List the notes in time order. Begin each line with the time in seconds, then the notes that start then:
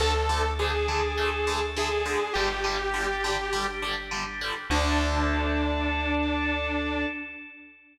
0.00 D2 D3 A3 D4 A4
0.29 D3 A3
0.59 D3 A3 G#4
0.88 D3 A3
1.18 D3 A3
1.47 D3 A3
1.76 D3 A3 G#4
2.06 D3 A3
2.33 G1 D3 G3 D4 G4
2.64 D3 G3
2.94 D3 G3
3.24 D3 G3
3.53 D3 G3
3.82 D3 G3
4.11 D3 G3
4.41 D3 G3
4.70 D2 D3 A3 D4 A4